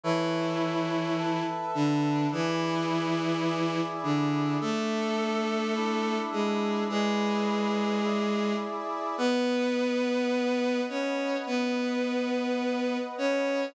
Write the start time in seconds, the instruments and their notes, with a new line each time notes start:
0.03 violin E3 E4, brass section A4 B4 C#5 E5
1.18 brass section A4 B4 E5 A5
1.75 violin D3 D4
2.32 violin E3 E4, brass section E4 G#4 B4 D5
3.46 brass section E4 G#4 D5 E5
4.03 violin D3 D4
4.61 violin A3 A4, brass section D4 A4 E5
5.75 brass section D4 E4 E5
6.32 violin G#3 G#4
6.89 violin G#3 G#4, brass section E4 G#4 B4 D5
8.03 brass section E4 G#4 D5 E5
9.18 violin B3 B4, brass section B4 D#5 F#5
10.89 violin C#4 C#5
11.46 violin B3 B4
13.18 violin C#4 C#5